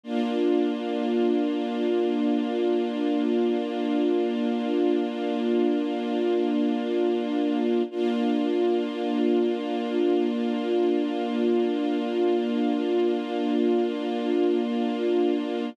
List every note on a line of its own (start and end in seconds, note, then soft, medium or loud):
0.03 7.82 A#3 medium
0.03 7.82 D4 medium
0.03 7.82 F4 medium
7.91 15.69 A#3 medium
7.91 15.69 D4 medium
7.91 15.69 F4 medium